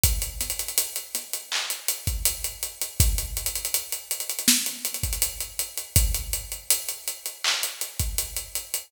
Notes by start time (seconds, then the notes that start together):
0.04 kick, closed hi-hat
0.22 closed hi-hat
0.41 snare, closed hi-hat
0.50 closed hi-hat
0.59 closed hi-hat
0.68 closed hi-hat
0.78 closed hi-hat
0.96 closed hi-hat
1.15 snare, closed hi-hat
1.33 closed hi-hat
1.52 clap
1.70 closed hi-hat
1.88 closed hi-hat
2.07 kick, closed hi-hat
2.25 closed hi-hat
2.44 closed hi-hat
2.63 closed hi-hat
2.81 closed hi-hat
3.00 kick, closed hi-hat
3.18 closed hi-hat
3.37 closed hi-hat
3.46 closed hi-hat
3.56 closed hi-hat
3.65 closed hi-hat
3.74 closed hi-hat
3.92 closed hi-hat
4.11 closed hi-hat
4.20 closed hi-hat
4.29 closed hi-hat
4.39 closed hi-hat
4.48 snare
4.66 closed hi-hat
4.85 closed hi-hat
4.94 closed hi-hat
5.03 kick, closed hi-hat
5.13 closed hi-hat
5.22 closed hi-hat
5.40 closed hi-hat
5.59 closed hi-hat
5.77 closed hi-hat
5.96 kick, closed hi-hat
6.15 closed hi-hat
6.33 closed hi-hat
6.52 closed hi-hat
6.70 closed hi-hat
6.89 closed hi-hat
7.08 closed hi-hat
7.26 closed hi-hat
7.44 clap
7.63 closed hi-hat
7.81 closed hi-hat
8.00 kick, closed hi-hat
8.18 closed hi-hat
8.37 closed hi-hat
8.55 closed hi-hat
8.74 closed hi-hat